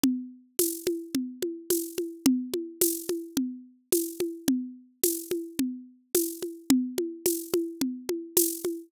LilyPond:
\new DrumStaff \drummode { \time 4/4 \tempo 4 = 108 cgl4 <cgho tamb>8 cgho8 cgl8 cgho8 <cgho tamb>8 cgho8 | cgl8 cgho8 <cgho tamb>8 cgho8 cgl4 <cgho tamb>8 cgho8 | cgl4 <cgho tamb>8 cgho8 cgl4 <cgho tamb>8 cgho8 | cgl8 cgho8 <cgho tamb>8 cgho8 cgl8 cgho8 <cgho tamb>8 cgho8 | }